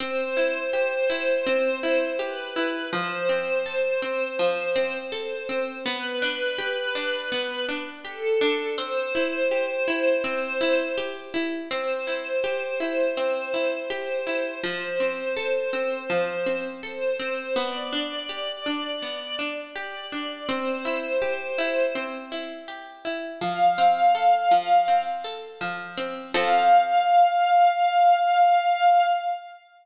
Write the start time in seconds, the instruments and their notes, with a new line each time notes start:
0.00 harpsichord C4, string ensemble 1 C5
0.37 harpsichord E4
0.73 harpsichord G4
1.10 harpsichord E4
1.46 harpsichord C4
1.83 harpsichord E4
2.19 harpsichord G4, string ensemble 1 B4
2.56 harpsichord E4
2.93 harpsichord F3, string ensemble 1 C5
3.29 harpsichord C4
3.66 harpsichord A4
4.02 harpsichord C4
4.39 harpsichord F3
4.76 harpsichord C4
5.12 harpsichord A4, string ensemble 1 C5
5.49 harpsichord C4
5.86 harpsichord B3, string ensemble 1 B4
6.22 harpsichord D4
6.58 harpsichord G4
6.95 harpsichord D4
7.32 harpsichord B3
7.68 harpsichord D4
8.05 harpsichord G4, string ensemble 1 A4
8.41 harpsichord D4
8.78 harpsichord C4, string ensemble 1 C5
9.15 harpsichord E4
9.51 harpsichord G4
9.88 harpsichord E4
10.24 harpsichord C4
10.61 harpsichord E4
10.98 harpsichord G4
11.34 harpsichord E4
11.71 harpsichord C4, string ensemble 1 C5
12.07 harpsichord E4
12.44 harpsichord G4
12.80 harpsichord E4
13.17 harpsichord C4
13.54 harpsichord E4
13.90 harpsichord G4, string ensemble 1 C5
14.27 harpsichord E4
14.63 harpsichord F3, string ensemble 1 C5
15.00 harpsichord C4
15.37 harpsichord A4
15.73 harpsichord C4
16.10 harpsichord F3
16.46 harpsichord C4
16.83 harpsichord A4, string ensemble 1 C5
17.20 harpsichord C4
17.56 harpsichord B3, string ensemble 1 D5
17.93 harpsichord D4
18.29 harpsichord G4
18.66 harpsichord D4
19.02 harpsichord B3
19.39 harpsichord D4
19.76 harpsichord G4, string ensemble 1 D5
20.12 harpsichord D4
20.49 harpsichord C4, string ensemble 1 C5
20.85 harpsichord E4
21.22 harpsichord G4
21.58 harpsichord E4
21.95 harpsichord C4
22.32 harpsichord E4
22.68 harpsichord G4
23.05 harpsichord E4
23.41 harpsichord F3, string ensemble 1 F5
23.78 harpsichord C4
24.15 harpsichord A4
24.51 harpsichord F3
24.88 harpsichord C4
25.24 harpsichord A4
25.61 harpsichord F3
25.97 harpsichord C4
26.34 harpsichord F3 C4 A4, string ensemble 1 F5